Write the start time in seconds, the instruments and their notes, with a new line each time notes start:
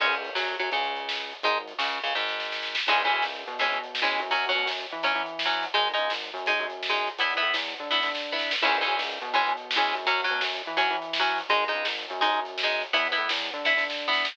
0.00 synth bass 1 C#2, overdriven guitar G#3 C#4, kick, crash
0.12 closed hi-hat
0.25 closed hi-hat
0.35 synth bass 1 F#2, overdriven guitar F#3, snare
0.48 closed hi-hat
0.59 synth bass 1 F#2, overdriven guitar F#3, closed hi-hat
0.72 synth bass 1 C#2, overdriven guitar C#3, kick, closed hi-hat
0.84 closed hi-hat
0.95 closed hi-hat
1.09 snare
1.20 closed hi-hat
1.31 closed hi-hat
1.43 synth bass 1 G#1, overdriven guitar G#3 D#4, kick, closed hi-hat
1.55 closed hi-hat
1.68 closed hi-hat
1.78 synth bass 1 C#2, overdriven guitar C#3, snare
1.91 closed hi-hat
2.03 synth bass 1 C#2, overdriven guitar C#3, closed hi-hat
2.15 synth bass 1 G#1, overdriven guitar G#2, kick, snare
2.28 snare
2.40 snare
2.52 snare
2.63 snare
2.75 snare
2.87 synth bass 1 C#2, overdriven guitar E3 G#3 C#4, kick, crash
3.00 closed hi-hat
3.05 overdriven guitar E3 G#3 C#4
3.11 synth bass 1 F#2, closed hi-hat
3.22 synth bass 1 C#2, snare
3.35 closed hi-hat
3.47 synth bass 1 B2, closed hi-hat
3.59 overdriven guitar E3 G#3 C#4, kick, closed hi-hat
3.71 synth bass 1 B2, closed hi-hat
3.84 closed hi-hat
3.95 snare
4.02 overdriven guitar E3 G#3 C#4
4.06 closed hi-hat
4.19 synth bass 1 F#2, closed hi-hat
4.30 overdriven guitar F#3 C#4, kick, closed hi-hat
4.44 closed hi-hat
4.49 overdriven guitar F#3 C#4
4.55 synth bass 1 B2, closed hi-hat
4.66 synth bass 1 F#2, snare
4.79 closed hi-hat
4.90 synth bass 1 E3, closed hi-hat
5.03 overdriven guitar F#3 C#4, kick, closed hi-hat
5.15 synth bass 1 E3, closed hi-hat
5.26 closed hi-hat
5.39 snare
5.45 overdriven guitar F#3 C#4
5.51 closed hi-hat
5.63 closed hi-hat
5.74 synth bass 1 G#1, overdriven guitar G#3 D#4, kick, closed hi-hat
5.87 closed hi-hat
5.93 overdriven guitar G#3 D#4
5.98 synth bass 1 C#2, closed hi-hat
6.10 synth bass 1 G#1, snare
6.23 closed hi-hat
6.34 synth bass 1 F#2, closed hi-hat
6.46 overdriven guitar G#3 D#4, kick, closed hi-hat
6.59 synth bass 1 F#2, closed hi-hat
6.70 closed hi-hat
6.83 snare
6.89 overdriven guitar G#3 D#4
6.94 closed hi-hat
7.06 closed hi-hat
7.19 synth bass 1 E2, overdriven guitar B3 E4, kick, closed hi-hat
7.30 closed hi-hat
7.37 overdriven guitar B3 E4
7.42 synth bass 1 A2, closed hi-hat
7.54 synth bass 1 E2, snare
7.67 closed hi-hat
7.78 synth bass 1 D3, closed hi-hat
7.89 overdriven guitar B3 E4, kick, snare
8.02 synth bass 1 D3, snare
8.15 snare
8.32 overdriven guitar B3 E4
8.39 snare
8.51 snare
8.62 synth bass 1 C#2, overdriven guitar E3 G#3 C#4, kick, crash
8.74 closed hi-hat
8.81 overdriven guitar E3 G#3 C#4
8.86 synth bass 1 F#2, closed hi-hat
8.98 synth bass 1 C#2, snare
9.10 closed hi-hat
9.21 synth bass 1 B2, closed hi-hat
9.33 overdriven guitar E3 G#3 C#4, kick, closed hi-hat
9.46 synth bass 1 B2, closed hi-hat
9.57 closed hi-hat
9.71 snare
9.76 overdriven guitar E3 G#3 C#4
9.82 closed hi-hat
9.94 synth bass 1 F#2, closed hi-hat
10.06 overdriven guitar F#3 C#4, kick, closed hi-hat
10.19 closed hi-hat
10.24 overdriven guitar F#3 C#4
10.30 synth bass 1 B2, closed hi-hat
10.41 synth bass 1 F#2, snare
10.53 closed hi-hat
10.65 synth bass 1 E3, closed hi-hat
10.77 overdriven guitar F#3 C#4, kick, closed hi-hat
10.90 synth bass 1 E3, closed hi-hat
11.02 closed hi-hat
11.13 snare
11.19 overdriven guitar F#3 C#4
11.26 closed hi-hat
11.38 closed hi-hat
11.49 synth bass 1 G#1, overdriven guitar G#3 D#4, kick, closed hi-hat
11.62 closed hi-hat
11.68 overdriven guitar G#3 D#4
11.73 synth bass 1 C#2, closed hi-hat
11.85 synth bass 1 G#1, snare
11.98 closed hi-hat
12.09 synth bass 1 F#2, closed hi-hat
12.21 overdriven guitar G#3 D#4, kick, closed hi-hat
12.32 synth bass 1 F#2, closed hi-hat
12.45 closed hi-hat
12.58 snare
12.63 overdriven guitar G#3 D#4
12.70 closed hi-hat
12.82 closed hi-hat
12.93 synth bass 1 E2, overdriven guitar B3 E4, kick, closed hi-hat
13.05 closed hi-hat
13.12 overdriven guitar B3 E4
13.17 synth bass 1 A2, closed hi-hat
13.29 synth bass 1 E2, snare
13.41 closed hi-hat
13.53 synth bass 1 D3, closed hi-hat
13.64 overdriven guitar B3 E4, kick, snare
13.77 synth bass 1 D3, snare
13.90 snare
14.08 overdriven guitar B3 E4
14.13 snare
14.25 snare